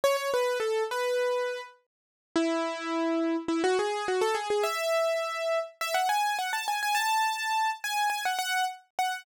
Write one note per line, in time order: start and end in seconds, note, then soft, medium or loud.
0.04 0.16 C#5 loud
0.17 0.30 C#5 loud
0.34 0.58 B4 loud
0.60 0.83 A4 medium
0.91 1.61 B4 medium
2.36 3.36 E4 loud
3.48 3.62 E4 medium
3.64 3.77 F#4 loud
3.79 4.06 G#4 loud
4.08 4.22 F#4 loud
4.21 4.35 A4 loud
4.35 4.48 G#4 loud
4.50 4.64 G#4 loud
4.63 5.59 E5 loud
5.81 5.95 E5 loud
5.94 6.08 F#5 medium
6.09 6.37 G#5 loud
6.39 6.52 F#5 medium
6.53 6.67 A5 medium
6.68 6.81 G#5 medium
6.83 6.96 G#5 loud
6.95 7.70 A5 loud
7.84 8.08 G#5 loud
8.10 8.23 G#5 loud
8.25 8.38 F#5 medium
8.39 8.65 F#5 loud
8.99 9.25 F#5 medium